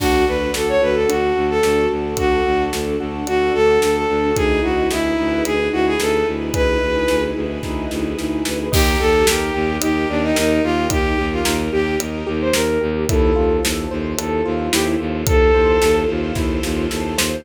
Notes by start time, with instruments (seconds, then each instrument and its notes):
0.00 violin D2 F#4, acoustic grand piano D4, string ensemble 1 D4 F#4 A4, kick, crash
0.27 violin D2 B4, acoustic grand piano F#4
0.54 violin D2 A4, acoustic grand piano A4, snare
0.69 violin C#5
0.82 violin D2 B4, acoustic grand piano F#4
0.95 violin A4
1.09 violin D2 F#4, acoustic grand piano D4, closed hi-hat
1.36 violin D2, acoustic grand piano F#4
1.50 violin A4
1.63 violin D2, acoustic grand piano A4, snare
1.91 violin D2, acoustic grand piano F#4
2.17 violin D2 F#4, acoustic grand piano D4, kick, closed hi-hat
2.45 violin D2, acoustic grand piano F#4
2.73 violin D2, acoustic grand piano A4, snare
3.00 violin D2, acoustic grand piano F#4
3.27 violin D2 F#4, acoustic grand piano D4, closed hi-hat
3.54 violin D2 A4, acoustic grand piano F#4
3.82 violin D2 A4, acoustic grand piano A4, snare
3.96 violin A4
4.09 violin D2, acoustic grand piano F#4
4.36 violin D2 G#4, string ensemble 1 D#4 E4 G#4 B4, acoustic grand piano D#4, kick, closed hi-hat
4.63 violin D2 F#4, acoustic grand piano E4
4.91 violin D2 E4, acoustic grand piano G#4, snare
5.18 violin D2, acoustic grand piano B4
5.45 violin D2 G#4, acoustic grand piano G#4, closed hi-hat
5.72 violin D2 F#4, acoustic grand piano E4
5.87 violin G#4
6.00 violin D2 A4, acoustic grand piano D#4, snare
6.27 violin D2, acoustic grand piano E4
6.54 violin D2 B4, acoustic grand piano G#4, kick, closed hi-hat
6.82 violin D2, acoustic grand piano B4
7.08 violin D2, acoustic grand piano G#4, snare
7.36 violin D2, acoustic grand piano E4
7.63 violin D2, acoustic grand piano D#4, kick, snare
7.91 violin D2, acoustic grand piano E4, snare
8.17 violin D2, acoustic grand piano G#4, snare
8.45 violin D2, acoustic grand piano B4, snare
8.72 violin D#2 G4, acoustic grand piano D#4, string ensemble 1 D#4 G4 A#4, kick, crash
9.00 violin D#2 A4, acoustic grand piano G4
9.27 violin D#2 G4, acoustic grand piano A#4, snare
9.54 violin D#2, acoustic grand piano G4
9.81 violin D#2 G4, acoustic grand piano D#4, closed hi-hat
10.09 violin D#2 D4, acoustic grand piano G4
10.23 violin D#4
10.35 violin D#2 D#4, acoustic grand piano A#4, snare
10.64 violin D#2 F4, acoustic grand piano G4
10.90 violin D#2 G4, acoustic grand piano D#4, kick, closed hi-hat
11.18 violin D#2, acoustic grand piano G4
11.32 violin F4
11.45 violin D#2, acoustic grand piano A#4, snare
11.73 violin D#2 G4, acoustic grand piano G4
12.00 violin D#2, acoustic grand piano D#4, closed hi-hat
12.27 violin D#2, acoustic grand piano G4
12.41 violin C5
12.53 violin D#2 A#4, acoustic grand piano A#4, snare
12.81 violin D#2, acoustic grand piano G4
13.09 violin D#2 A4, string ensemble 1 E4 F4 A4 C5, acoustic grand piano E4, kick, closed hi-hat
13.35 violin D#2, acoustic grand piano F4
13.63 violin D#2, acoustic grand piano A4, snare
13.91 violin D#2, acoustic grand piano C5
14.18 violin D#2 A4, acoustic grand piano A4, closed hi-hat
14.45 violin D#2, acoustic grand piano F4
14.73 violin D#2 G4, acoustic grand piano E4, snare
15.00 violin D#2, acoustic grand piano F4
15.27 violin D#2 A4, acoustic grand piano A4, kick, closed hi-hat
15.54 violin D#2, acoustic grand piano C5
15.82 violin D#2, acoustic grand piano A4, snare
16.09 violin D#2, acoustic grand piano F4
16.35 violin D#2, acoustic grand piano E4, kick, snare
16.63 violin D#2, acoustic grand piano F4, snare
16.90 violin D#2, acoustic grand piano A4, snare
17.18 violin D#2, acoustic grand piano C5, snare